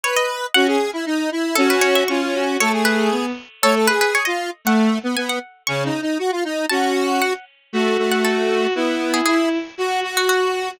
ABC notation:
X:1
M:2/4
L:1/16
Q:1/4=117
K:F#dor
V:1 name="Harpsichord"
c d3 | f8 | A B c e c'4 | c2 B4 z2 |
A2 B B c d3 | f4 g f3 | c'8 | a2 z2 f2 z2 |
z3 f A2 z2 | z3 G G2 z2 | z3 F F2 z2 |]
V:2 name="Lead 1 (square)"
B4 | F G2 E D2 E2 | C4 C4 | A G5 z2 |
c A G3 ^E2 z | A,3 B, B,2 z2 | (3C2 D2 D2 F ^E D2 | F6 z2 |
A,2 A,6 | B,4 E2 z2 | F2 F6 |]
V:3 name="Violin"
z4 | C2 z6 | F3 F ^E E F2 | A,4 B,2 z2 |
A,2 z6 | A,2 z6 | C,2 z6 | C4 z4 |
F8 | E8 | F8 |]